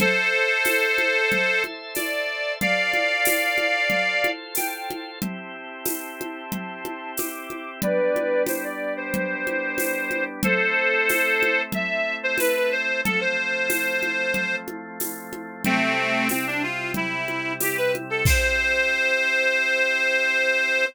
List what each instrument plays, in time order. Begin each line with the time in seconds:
0.00 accordion A4 C5, drawbar organ A4 C5 E5, low conga
0.65 tambourine, high conga
0.98 high conga
1.32 low conga
1.64 high conga
1.95 accordion D5, tambourine, high conga
2.61 drawbar organ F4 A4 C5, accordion D5 F5, low conga
2.93 high conga
3.25 tambourine, high conga
3.58 high conga
3.90 low conga
4.24 high conga
4.55 accordion G5, tambourine, high conga
4.90 high conga
5.21 drawbar organ C4 E4 G4, accordion A5 C6, low conga
5.85 tambourine, high conga
6.21 high conga
6.52 low conga
6.85 high conga
7.17 accordion D6, tambourine, high conga
7.50 high conga
7.82 drawbar organ G3 B3 D4, accordion B4 D5, low conga
8.16 high conga
8.46 accordion C5, tambourine, high conga
8.64 accordion D5
8.97 accordion C5
9.14 low conga
9.47 high conga
9.78 tambourine, high conga
10.11 high conga
10.43 drawbar organ A3 C4 E4, accordion A4 C5, low conga
11.09 tambourine, high conga
11.43 high conga
11.72 accordion E5, low conga
12.23 accordion C5
12.38 accordion B4, tambourine, high conga
12.56 accordion B4
12.72 accordion C5
13.04 drawbar organ F3 A3 C4, accordion A4, low conga
13.21 accordion C5
13.70 tambourine, high conga
14.03 high conga
14.34 low conga
14.68 high conga
15.00 tambourine, high conga
15.33 high conga
15.65 drawbar organ C3 G3 E4, accordion A3 C4, low conga
16.29 accordion C4, tambourine, high conga
16.47 accordion D4
16.63 accordion F4
16.94 accordion E4, low conga
17.28 high conga
17.60 accordion G4, tambourine, high conga
17.77 accordion B4
17.95 high conga
18.10 accordion A4
18.25 drawbar organ C4 E4 G4, accordion C5, kick, crash